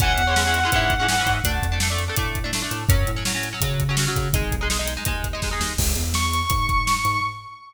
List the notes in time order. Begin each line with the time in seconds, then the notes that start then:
0.00 C#2 E3 G#3 C#4 F#5, kick, closed hi-hat
0.18 E2, closed hi-hat
0.27 E3 G#3 C#4
0.36 E3 G#3 C#4, snare
0.45 E3 G#3 C#4
0.54 closed hi-hat
0.63 E3 G#3 C#4
0.72 G#2 E3 G#3 C#4, kick, closed hi-hat
0.90 kick, closed hi-hat
0.99 E3 G#3 C#4
1.08 E3 G#3 C#4, snare
1.18 E3 G#3 C#4
1.26 G#2, kick, closed hi-hat
1.44 D2 A3 D4, kick, closed hi-hat
1.62 F2, kick, closed hi-hat
1.72 A3 D4
1.80 A3 D4, snare
1.90 A3 D4
1.98 closed hi-hat
2.08 A3 D4
2.16 A2 A3 D4, kick, closed hi-hat
2.35 kick, closed hi-hat
2.44 A3 D4
2.53 A3 D4, snare
2.62 A3 D4
2.71 A2, closed hi-hat
2.89 F#2 F#3 C#4, kick, closed hi-hat
3.07 A2, closed hi-hat
3.16 F#3 C#4
3.25 F#3 C#4, snare
3.34 F#3 C#4
3.43 closed hi-hat
3.52 F#3 C#4
3.61 C#3 F#3 C#4, kick, closed hi-hat
3.80 kick, closed hi-hat
3.89 F#3 C#4
3.97 F#3 C#4, snare
4.07 F#3 C#4
4.16 C#3, kick, closed hi-hat
4.33 G#1 G#3 D#4, kick, closed hi-hat
4.51 B1, kick, closed hi-hat
4.61 G#3 D#4
4.70 G#3 D#4, snare
4.79 G#3 D#4
4.88 closed hi-hat
4.97 G#3 D#4
5.05 D#2 G#3 D#4, kick, closed hi-hat
5.24 kick, closed hi-hat
5.33 G#3 D#4
5.42 G#3 D#4, kick, snare
5.51 G#3 D#4
5.60 D#2, snare
5.78 C#2, kick, crash
5.95 E2, closed hi-hat
6.14 C#6, snare
6.33 closed hi-hat
6.50 G#2, kick, closed hi-hat
6.69 kick, closed hi-hat
6.87 snare
7.05 G#2, closed hi-hat